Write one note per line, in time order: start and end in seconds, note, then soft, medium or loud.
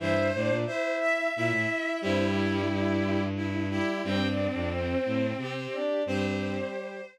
0.00 0.31 G2 medium
0.00 0.14 E3 medium
0.00 0.28 E4 loud
0.00 0.55 C5 medium
0.00 0.28 E5 loud
0.34 0.50 A2 medium
0.34 0.64 D4 medium
0.34 0.64 D5 medium
0.49 0.65 A#2 medium
0.66 1.29 E4 medium
0.66 0.95 C5 medium
0.66 1.29 E5 medium
1.00 1.32 E5 medium
1.35 1.52 A#2 medium
1.35 2.02 E4 medium
1.35 1.99 E5 medium
1.51 1.67 A2 medium
2.02 3.79 G2 medium
2.02 2.62 G3 loud
2.02 2.24 C4 medium
2.02 3.21 E4 medium
2.02 2.24 C5 loud
2.25 2.46 G3 medium
2.25 2.46 G4 medium
2.46 2.68 G3 medium
2.46 2.68 G4 medium
2.69 3.24 G3 medium
2.69 3.24 G4 medium
3.36 3.67 E4 medium
3.70 4.02 G3 medium
3.70 4.01 E4 medium
3.70 4.02 G4 loud
4.04 4.48 G2 medium
4.04 4.20 G3 medium
4.04 5.74 C4 medium
4.04 4.28 G4 loud
4.04 4.28 G5 loud
4.28 4.48 D4 medium
4.28 4.48 D5 medium
4.48 4.70 D4 medium
4.48 4.70 D5 medium
4.54 4.95 F2 medium
4.72 5.27 C4 medium
4.72 5.27 C5 medium
5.06 5.33 A2 medium
5.37 5.67 C3 medium
5.37 6.02 G4 medium
5.72 6.04 D4 medium
5.72 6.04 D5 medium
6.06 6.60 G2 medium
6.06 7.01 G3 loud
6.06 6.69 C4 medium
6.06 7.01 G4 loud
6.06 7.06 C5 medium